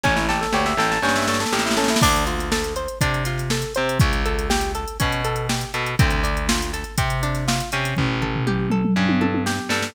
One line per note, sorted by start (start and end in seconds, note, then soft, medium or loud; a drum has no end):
0.04 0.46 A1 medium
0.04 0.15 C#4 medium
0.04 0.26 C#4 medium
0.04 kick medium
0.04 snare medium
0.16 0.27 E4 medium
0.16 snare medium
0.29 0.40 G4 medium
0.29 0.51 A4 medium
0.29 snare medium
0.41 0.52 A4 medium
0.41 snare medium
0.52 0.74 D2 medium
0.52 0.76 G4 medium
0.52 0.65 C#5 medium
0.52 snare medium
0.66 0.77 E5 medium
0.66 snare medium
0.77 0.98 A1 medium
0.77 1.01 A4 medium
0.77 0.89 G5 medium
0.77 snare medium
0.91 1.02 A5 medium
0.91 snare medium
1.02 1.45 G2 medium
1.02 1.25 C#4 medium
1.02 1.14 G5 medium
1.02 snare medium
1.08 snare medium
1.15 1.27 E5 medium
1.15 snare medium
1.22 snare medium
1.27 1.50 A4 medium
1.27 1.39 C#5 medium
1.27 snare medium
1.34 snare medium
1.40 1.51 A4 medium
1.40 snare medium
1.46 snare medium
1.52 1.95 A1 medium
1.52 1.64 G4 medium
1.52 1.75 G4 medium
1.52 snare medium
1.59 snare medium
1.65 1.76 E4 medium
1.65 snare medium
1.71 snare medium
1.77 1.89 C#4 medium
1.77 2.00 A4 medium
1.77 snare medium
1.84 snare medium
1.88 2.01 E4 medium
1.88 snare loud
1.96 snare loud
2.02 2.87 D2 medium
2.02 2.25 D4 loud
2.02 kick loud
2.02 crash loud
2.16 closed hi-hat medium
2.27 2.49 F4 medium
2.27 closed hi-hat medium
2.39 snare soft
2.39 closed hi-hat medium
2.52 2.74 A4 medium
2.52 snare loud
2.64 closed hi-hat medium
2.76 2.99 C5 medium
2.76 closed hi-hat medium
2.88 closed hi-hat medium
3.01 3.64 C3 medium
3.01 3.23 D4 medium
3.01 kick medium
3.01 closed hi-hat loud
3.14 closed hi-hat medium
3.25 3.48 F4 medium
3.25 snare soft
3.25 closed hi-hat medium
3.38 snare soft
3.38 closed hi-hat medium
3.50 3.73 A4 medium
3.50 snare loud
3.62 closed hi-hat medium
3.75 3.98 C3 medium
3.75 3.98 C5 medium
3.75 closed hi-hat medium
3.89 closed hi-hat medium
3.99 4.85 C#2 medium
3.99 4.23 C#4 medium
3.99 kick loud
3.99 closed hi-hat medium
4.13 closed hi-hat medium
4.25 4.48 A4 medium
4.25 closed hi-hat medium
4.39 closed hi-hat medium
4.50 4.72 G4 medium
4.50 snare loud
4.61 closed hi-hat medium
4.75 4.97 A4 medium
4.75 closed hi-hat medium
4.88 closed hi-hat medium
5.00 5.65 B2 medium
5.00 5.22 C#4 medium
5.00 kick medium
5.00 closed hi-hat loud
5.12 closed hi-hat medium
5.24 5.47 A4 medium
5.24 closed hi-hat medium
5.36 closed hi-hat medium
5.49 5.71 G4 medium
5.49 snare loud
5.61 closed hi-hat medium
5.74 5.95 B2 medium
5.74 5.96 A4 medium
5.74 closed hi-hat medium
5.86 closed hi-hat medium
5.99 6.84 D2 medium
5.99 6.21 C4 medium
5.99 kick loud
5.99 closed hi-hat loud
6.10 closed hi-hat medium
6.24 6.46 D4 medium
6.24 closed hi-hat medium
6.37 closed hi-hat medium
6.49 6.71 F4 medium
6.49 snare loud
6.62 closed hi-hat medium
6.73 6.96 A4 medium
6.73 snare soft
6.73 closed hi-hat medium
6.84 closed hi-hat medium
6.98 7.61 C3 medium
6.98 7.20 C4 medium
6.98 kick medium
6.98 closed hi-hat loud
7.10 closed hi-hat medium
7.23 7.45 D4 medium
7.23 closed hi-hat medium
7.35 snare soft
7.35 closed hi-hat medium
7.48 7.70 F4 medium
7.48 snare loud
7.60 closed hi-hat medium
7.72 7.94 C3 medium
7.72 8.20 C#4 medium
7.72 closed hi-hat medium
7.84 snare soft
7.84 closed hi-hat medium
7.96 8.82 A1 medium
7.96 kick medium
7.96 floor tom medium
8.22 8.44 A4 medium
8.22 floor tom medium
8.36 floor tom medium
8.47 8.69 G4 medium
8.47 mid tom medium
8.70 8.94 A4 medium
8.70 mid tom medium
8.85 mid tom medium
8.96 9.59 G2 medium
8.96 9.19 C#4 medium
9.09 high tom medium
9.21 9.43 A4 medium
9.21 high tom medium
9.34 high tom medium
9.46 9.68 G4 medium
9.46 snare medium
9.69 9.90 G2 medium
9.69 9.93 A4 medium
9.69 snare medium
9.82 snare medium